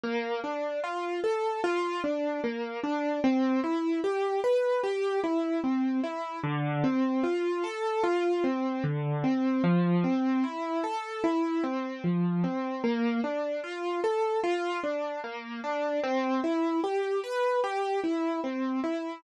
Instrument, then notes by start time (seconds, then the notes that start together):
acoustic grand piano
0.04 A#3
0.44 D4
0.84 F4
1.24 A4
1.64 F4
2.04 D4
2.44 A#3
2.83 D4
3.24 C4
3.64 E4
4.04 G4
4.44 B4
4.83 G4
5.24 E4
5.64 C4
6.04 E4
6.44 D3
6.84 C4
7.24 F4
7.64 A4
8.04 F4
8.44 C4
8.84 D3
9.24 C4
9.64 F3
10.04 C4
10.44 E4
10.84 A4
11.24 E4
11.64 C4
12.04 F3
12.44 C4
12.84 A#3
13.24 D4
13.64 F4
14.04 A4
14.44 F4
14.84 D4
15.24 A#3
15.64 D4
16.04 C4
16.44 E4
16.84 G4
17.23 B4
17.64 G4
18.04 E4
18.44 C4
18.84 E4